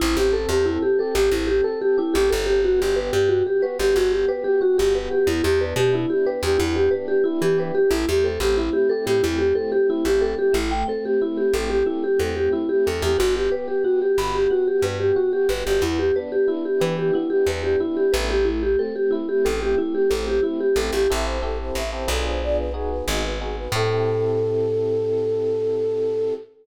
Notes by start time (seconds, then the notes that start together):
0.00 A1 C4 E4
0.17 A1 G4
0.33 A4
0.49 E2 G4
0.64 C4 E4
0.82 G4
0.99 G4 A4
1.15 A1 G4
1.31 A1 C4 E4
1.47 G4
1.64 A4
1.81 G4
1.98 E4 G4
2.14 A1 G4
2.30 G1 C4 A4
2.46 G4
2.64 B3 F#4
2.80 G1 G4
2.96 G4 B4
3.13 G2 G4
3.29 B3 F#4
3.47 G4
3.62 F#4 B4
3.79 G1 G4
3.95 G1 B3 F#4
4.12 G4
4.28 G4 B4
4.44 G4
4.61 F#4
4.78 G1 G4
4.95 B3 B4
5.11 G4
5.27 E2 E4
5.44 E2 G4
5.61 D4 B4
5.76 B2 G4
5.93 E4
6.10 G4
6.26 G4 B4
6.43 E2 G4
6.58 E2 B3 E4
6.76 G4
6.91 D4 B4
7.08 G4
7.24 E4
7.41 E3 G4
7.58 G4 B4
7.75 G4
7.91 A1 A3 E4
8.09 E2 G4
8.24 C4 A4
8.40 A1 G4
8.57 E4
8.73 G4
8.89 G4 A4
9.06 A2 G4
9.23 E2 A3 E4
9.38 G4
9.55 C4 A4
9.72 G4
9.90 E4
10.05 A1 G4
10.21 G4 A4
10.39 G4
10.53 A1 A3 E4
10.71 G5
10.88 C4 A4
11.05 G4
11.21 E4
11.37 G4
11.54 A1 G4 A4
11.70 G4
11.86 A3 E4
12.04 G4
12.20 E2 C4 A4
12.36 G4
12.52 E4
12.69 G4
12.86 E2 G4 A4
13.02 E2 G4
13.18 G1 B3 F#4
13.36 G4
13.51 G4 B4
13.68 G4
13.84 B3 F#4
14.02 G4
14.18 G1 F#4 B5
14.35 G4
14.50 B3 F#4
14.67 G4
14.82 G2 G4 B4
15.00 G4
15.16 F#4
15.33 G4
15.49 G1 B3 B4
15.66 G1 G4
15.82 E2 B3 E4
15.99 G4
16.16 D4 B4
16.32 G4
16.48 E4
16.65 G4
16.80 E3 G4 B4
16.99 G4
17.13 B3 E4
17.30 G4
17.47 E2 D4 B4
17.63 G4
17.80 E4
17.97 G4
18.13 A1 A3 B4
18.30 G4
18.45 E4
18.63 G4
18.79 C4 A4
18.96 G4
19.11 E4
19.29 G4
19.45 A1 G4 A4
19.62 G4
19.78 A3 E4
19.95 G4
20.10 A1 C4 A4
20.27 G4
20.43 E4
20.60 G4
20.76 A1 G4 A4
20.93 A1 G4
21.10 A1 C4 E4 G4 A4 E5
21.26 C5
21.42 C4 E4 G4 A4
21.60 C5
21.75 A1 E5
21.93 C4 E4 G4 A4 C5
22.08 B1 B3 D4 F4 G#4 A4
22.26 C5
22.42 D5
22.58 B4
22.74 B3 D#4 F#4 G#4
22.90 B4
23.08 G#1 D#5
23.24 B4
23.41 B3 D#4 F#4 G#4
23.57 B4
23.72 A2 C4 E4 G4 A4